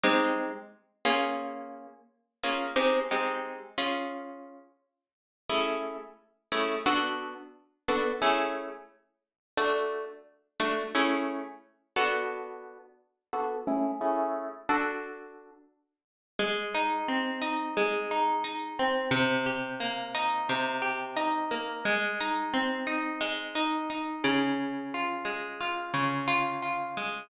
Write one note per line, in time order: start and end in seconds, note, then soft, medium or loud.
0.04 0.51 G#3 loud
0.04 0.51 C4 medium
0.04 0.51 D#4 medium
0.04 0.51 G4 medium
1.05 1.87 A#3 medium
1.05 1.87 C#4 medium
1.05 1.87 F4 medium
1.05 1.87 G#4 medium
2.43 2.67 A#3 medium
2.43 2.67 C#4 medium
2.43 2.67 F4 medium
2.43 2.67 G#4 medium
2.76 3.00 G#3 medium
2.76 3.00 C4 medium
2.76 3.00 D#4 medium
2.76 3.00 G4 medium
3.11 3.59 G#3 medium
3.11 3.59 C4 medium
3.11 3.59 D#4 medium
3.11 3.59 G4 medium
3.78 4.60 C#4 medium
3.78 4.60 F4 medium
3.78 4.60 G#4 medium
5.50 5.97 A3 medium
5.50 5.97 C#4 medium
5.50 5.97 E4 medium
5.50 5.97 G#4 medium
6.52 6.76 A3 medium
6.52 6.76 C#4 medium
6.52 6.76 E4 medium
6.52 6.76 G#4 medium
6.86 7.34 B3 medium
6.86 7.34 D4 medium
6.86 7.34 F#4 medium
6.86 7.34 A4 medium
7.88 8.12 B3 medium
7.88 8.12 D4 medium
7.88 8.12 F#4 medium
7.88 8.12 A4 medium
8.22 8.69 A3 medium
8.22 8.69 C#4 medium
8.22 8.69 E4 medium
8.22 8.69 G#4 medium
9.57 10.05 A3 medium
9.57 10.05 D4 medium
9.57 10.05 F#4 medium
10.60 10.84 A3 medium
10.60 10.84 D4 medium
10.60 10.84 F#4 medium
10.95 11.42 A3 loud
10.95 11.42 C#4 medium
10.95 11.42 E4 medium
10.95 11.42 G#4 medium
11.96 12.78 B3 medium
11.96 12.78 D4 medium
11.96 12.78 F#4 medium
11.96 12.78 A4 medium
13.33 13.57 B3 medium
13.33 13.57 D4 medium
13.33 13.57 F#4 medium
13.33 13.57 A4 medium
13.67 13.91 A3 medium
13.67 13.91 C#4 medium
13.67 13.91 E4 medium
13.67 13.91 G#4 medium
14.01 14.49 A3 medium
14.01 14.49 C#4 medium
14.01 14.49 E4 medium
14.01 14.49 G#4 medium
14.69 15.51 D4 medium
14.69 15.51 F#4 medium
14.69 15.51 A4 medium
16.39 17.76 G#3 loud
16.75 17.41 D#4 medium
17.08 18.79 C4 medium
17.42 18.11 D#4 medium
17.77 19.06 G#3 loud
18.11 18.44 D#4 medium
18.44 19.09 D#4 medium
18.79 19.12 C4 medium
19.11 20.49 C3 loud
19.46 20.81 G4 medium
19.80 21.51 A#3 loud
20.15 21.16 D#4 loud
20.49 21.79 C3 loud
20.82 21.79 G4 medium
21.17 21.81 D#4 medium
21.51 21.84 A#3 medium
21.85 23.20 G#3 loud
22.21 22.86 D#4 medium
22.54 24.48 C4 loud
22.87 23.55 D#4 medium
23.21 24.50 G#3 loud
23.55 23.89 D#4 medium
23.90 24.55 D#4 medium
24.24 25.93 C#3 loud
24.94 25.60 F4 medium
25.25 26.97 G#3 medium
25.61 26.27 F4 medium
25.94 27.23 C#3 loud
26.28 26.62 F4 loud
26.62 27.27 F4 medium
26.97 27.29 G#3 medium